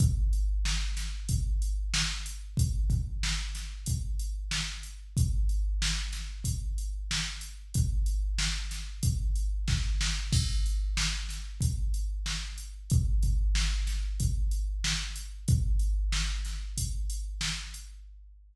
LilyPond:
\new DrumStaff \drummode { \time 4/4 \tempo 4 = 93 <hh bd>8 hh8 sn8 <hh sn>8 <hh bd>8 hh8 sn8 hh8 | <hh bd>8 <hh bd>8 sn8 <hh sn>8 <hh bd>8 hh8 sn8 hh8 | <hh bd>8 hh8 sn8 <hh sn>8 <hh bd>8 hh8 sn8 hh8 | <hh bd>8 hh8 sn8 <hh sn>8 <hh bd>8 hh8 <bd sn>8 sn8 |
<cymc bd>8 hh8 sn8 <hh sn>8 <hh bd>8 hh8 sn8 hh8 | <hh bd>8 <hh bd>8 sn8 <hh sn>8 <hh bd>8 hh8 sn8 hh8 | <hh bd>8 hh8 sn8 <hh sn>8 <hh bd>8 hh8 sn8 hh8 | }